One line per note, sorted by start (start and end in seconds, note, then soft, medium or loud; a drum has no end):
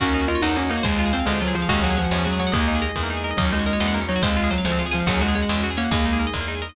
0.00 0.38 D#2 loud
0.00 0.06 A#3 loud
0.00 0.84 A#3 medium
0.00 0.26 C#4 loud
0.00 0.84 C#4 medium
0.00 0.84 D#4 medium
0.00 0.84 F#4 medium
0.00 0.72 F#4 loud
0.00 0.56 A#4 medium
0.00 kick loud
0.00 closed hi-hat loud
0.07 0.13 C#4 medium
0.14 0.20 D#4 medium
0.14 0.70 C#5 medium
0.21 0.28 F#4 medium
0.28 0.40 F4 medium
0.28 0.35 A#4 medium
0.28 0.82 D#5 medium
0.28 closed hi-hat medium
0.35 0.41 C#5 medium
0.42 0.80 E2 medium
0.42 0.55 D#4 loud
0.42 0.49 D#5 medium
0.42 0.82 F#5 medium
0.42 snare loud
0.49 0.55 F#5 medium
0.56 0.62 A#3 medium
0.56 0.69 C#4 medium
0.56 0.83 A#4 medium
0.63 0.70 C#4 medium
0.69 0.81 A#3 medium
0.69 0.77 D#4 medium
0.69 0.84 C#5 medium
0.69 closed hi-hat medium
0.77 0.84 F#4 medium
0.83 1.23 D#2 loud
0.83 0.91 G#3 medium
0.83 1.10 G#3 loud
0.83 1.69 G#3 medium
0.83 1.69 C4 medium
0.83 1.69 F4 medium
0.83 1.12 G#4 medium
0.83 1.23 C5 medium
0.83 kick loud
0.83 closed hi-hat loud
0.91 0.98 C4 medium
0.99 1.05 F4 medium
0.99 1.54 F5 medium
1.06 1.12 G#4 medium
1.13 1.25 C4 medium
1.13 1.40 G#4 medium
1.13 1.19 C5 medium
1.13 closed hi-hat medium
1.20 1.26 F5 medium
1.25 1.65 D2 medium
1.25 1.37 G#3 medium
1.25 1.33 G#3 medium
1.25 1.67 C5 medium
1.25 snare loud
1.34 1.40 C4 medium
1.41 1.53 F#3 loud
1.41 1.47 F4 medium
1.41 1.68 G#4 medium
1.48 1.54 G#4 medium
1.54 1.68 F3 medium
1.54 1.61 C5 medium
1.54 1.68 F5 medium
1.54 closed hi-hat medium
1.62 1.68 F5 medium
1.69 2.07 D#2 loud
1.69 1.80 G#3 loud
1.69 1.75 G#3 loud
1.69 2.53 G#3 medium
1.69 2.53 C#4 medium
1.69 2.50 F#4 medium
1.69 2.53 F#4 medium
1.69 1.97 G#4 loud
1.69 kick loud
1.69 closed hi-hat loud
1.76 1.82 C#4 medium
1.83 1.96 F#3 loud
1.83 1.89 F#4 medium
1.83 2.39 F#5 medium
1.90 1.97 G#4 medium
1.97 2.23 F3 loud
1.97 2.25 G#4 medium
1.97 2.03 C#5 medium
1.97 closed hi-hat medium
2.04 2.11 F#5 medium
2.11 2.49 E2 medium
2.11 2.18 G#3 medium
2.11 2.51 C#5 medium
2.11 snare loud
2.18 2.25 C#4 medium
2.25 2.39 F#3 medium
2.25 2.31 F#4 medium
2.25 2.52 G#4 medium
2.33 2.39 G#4 medium
2.39 2.53 F#3 loud
2.39 2.46 C#5 medium
2.39 2.53 F#5 medium
2.39 closed hi-hat medium
2.47 2.53 F#5 medium
2.52 2.91 D#2 loud
2.52 2.60 G#3 medium
2.52 3.38 G#3 medium
2.52 2.76 A#3 loud
2.52 3.37 A#3 medium
2.52 3.37 D#4 medium
2.52 2.81 G#4 loud
2.52 3.01 D#5 medium
2.52 kick loud
2.52 closed hi-hat loud
2.61 2.67 A#3 medium
2.68 2.74 D#4 medium
2.68 3.23 D#5 medium
2.75 2.81 G#4 medium
2.82 3.09 G#4 medium
2.82 2.88 A#4 medium
2.82 closed hi-hat medium
2.89 2.95 D#5 medium
2.96 3.34 E2 medium
2.96 3.02 G#3 medium
2.96 3.36 A#4 medium
2.96 kick loud
2.96 snare loud
3.03 3.10 A#3 medium
3.10 3.16 D#4 medium
3.10 3.37 G#4 medium
3.10 snare loud
3.17 3.23 G#4 medium
3.24 3.30 A#4 medium
3.24 3.37 D#5 medium
3.31 3.37 D#5 medium
3.37 3.76 D#2 loud
3.37 3.50 F#3 loud
3.37 4.21 A#3 medium
3.37 3.45 A#3 loud
3.37 4.21 C#4 medium
3.37 4.21 D#4 medium
3.37 4.21 F#4 medium
3.37 3.52 A#4 medium
3.37 4.15 D#5 medium
3.37 kick loud
3.37 closed hi-hat loud
3.45 3.51 C#4 medium
3.52 3.66 G#3 loud
3.52 3.59 D#4 medium
3.52 3.66 C#5 medium
3.59 3.66 F#4 medium
3.66 3.94 G#3 loud
3.66 3.73 A#4 medium
3.66 3.80 D#5 medium
3.66 closed hi-hat medium
3.73 3.79 C#5 medium
3.80 4.18 E2 medium
3.80 3.87 D#5 medium
3.80 3.94 F#5 medium
3.80 snare loud
3.87 3.94 F#5 medium
3.94 4.01 A#3 medium
3.94 4.08 A#4 medium
4.01 4.07 C#4 medium
4.08 4.22 F#3 medium
4.08 4.15 D#4 medium
4.08 4.22 C#5 medium
4.08 closed hi-hat medium
4.16 4.22 F#4 medium
4.22 4.61 D#2 loud
4.22 5.05 G#3 medium
4.22 4.29 G#3 medium
4.22 4.48 G#3 loud
4.22 5.05 C4 medium
4.22 5.05 F4 medium
4.22 4.37 G#4 medium
4.22 4.87 C5 medium
4.22 kick loud
4.22 closed hi-hat loud
4.30 4.36 C4 medium
4.37 4.43 F4 medium
4.37 4.51 F5 medium
4.44 4.50 G#4 medium
4.50 4.63 F#3 loud
4.50 4.65 G#4 medium
4.50 4.57 C5 medium
4.50 closed hi-hat medium
4.58 4.64 F5 medium
4.65 5.03 D2 medium
4.65 4.78 F3 medium
4.65 4.71 G#3 medium
4.65 4.79 C5 medium
4.65 snare loud
4.72 4.78 C4 medium
4.79 4.85 F4 medium
4.79 4.93 G#4 medium
4.86 4.92 G#4 medium
4.91 5.07 F3 loud
4.91 5.04 G#4 medium
4.91 4.99 C5 medium
4.91 5.06 F5 medium
4.91 closed hi-hat medium
5.00 5.06 F5 medium
5.06 5.45 D#2 loud
5.06 5.22 F#3 loud
5.06 5.13 G#3 loud
5.06 5.91 G#3 medium
5.06 5.91 C#4 medium
5.06 5.63 F#4 medium
5.06 5.91 F#4 medium
5.06 5.21 G#4 loud
5.06 kick loud
5.06 closed hi-hat loud
5.14 5.20 C#4 medium
5.21 5.33 G#3 loud
5.21 5.28 F#4 medium
5.21 5.35 F#5 medium
5.28 5.35 G#4 medium
5.35 5.60 G#3 medium
5.35 5.49 G#4 medium
5.35 5.41 C#5 medium
5.35 closed hi-hat medium
5.42 5.49 F#5 medium
5.49 5.87 E2 medium
5.49 5.56 G#3 medium
5.49 5.63 C#5 medium
5.49 snare loud
5.57 5.63 C#4 medium
5.63 5.70 F#4 medium
5.63 5.77 G#4 medium
5.70 5.77 G#4 medium
5.77 5.90 A#3 loud
5.77 5.91 C#4 medium
5.77 5.83 C#5 medium
5.77 5.91 F#5 medium
5.77 closed hi-hat medium
5.85 5.91 F#5 medium
5.91 6.30 D#2 loud
5.91 5.98 G#3 medium
5.91 6.75 G#3 medium
5.91 6.75 A#3 medium
5.91 6.18 A#3 loud
5.91 6.56 D#4 medium
5.91 6.75 D#4 medium
5.91 6.06 G#4 loud
5.91 kick loud
5.91 closed hi-hat loud
5.99 6.05 A#3 medium
6.06 6.12 D#4 medium
6.06 6.20 D#5 medium
6.13 6.19 G#4 medium
6.19 6.34 G#4 medium
6.19 6.26 A#4 medium
6.19 closed hi-hat medium
6.27 6.33 D#5 medium
6.33 6.72 E2 medium
6.33 6.40 G#3 medium
6.33 6.48 A#4 medium
6.33 kick loud
6.33 snare loud
6.41 6.47 A#3 medium
6.48 6.54 D#4 medium
6.48 6.62 G#4 medium
6.48 snare loud
6.55 6.61 G#4 medium
6.62 6.68 A#4 medium
6.62 6.75 D#5 medium
6.69 6.75 D#5 medium